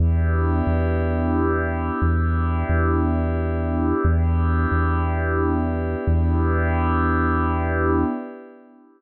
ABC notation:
X:1
M:3/4
L:1/8
Q:1/4=89
K:Edor
V:1 name="Pad 5 (bowed)"
[B,DEG]6 | [B,DEG]6 | [B,DEG]6 | [B,DEG]6 |]
V:2 name="Synth Bass 2" clef=bass
E,,2 E,,4 | E,,2 E,,4 | E,,2 E,,4 | E,,6 |]